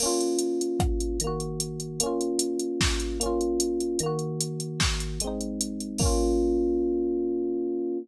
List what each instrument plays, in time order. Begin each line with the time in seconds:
0.00 electric piano 1 A#3 C#4, crash
0.06 electric piano 1 F4
0.21 closed hi-hat
0.39 closed hi-hat
0.61 closed hi-hat
0.80 kick, cross-stick
1.00 closed hi-hat
1.20 electric piano 1 D#3, closed hi-hat
1.24 electric piano 1 A#3 F#4
1.40 closed hi-hat
1.60 closed hi-hat
1.80 closed hi-hat
2.00 electric piano 1 A#3 C#4, closed hi-hat
2.06 electric piano 1 F4
2.21 closed hi-hat
2.39 closed hi-hat
2.59 closed hi-hat
2.81 kick, snare
3.00 closed hi-hat
3.20 electric piano 1 A#3 C#4, closed hi-hat
3.26 electric piano 1 F4
3.41 closed hi-hat
3.60 closed hi-hat
3.80 closed hi-hat
3.99 electric piano 1 D#3, closed hi-hat
4.03 electric piano 1 A#3 F#4
4.19 closed hi-hat
4.41 closed hi-hat
4.60 closed hi-hat
4.80 kick, snare
5.00 closed hi-hat
5.20 electric piano 1 G#3, closed hi-hat
5.24 electric piano 1 C4 D#4
5.41 closed hi-hat
5.61 closed hi-hat
5.80 closed hi-hat
5.98 electric piano 1 A#3 C#4, kick, crash
6.05 electric piano 1 F4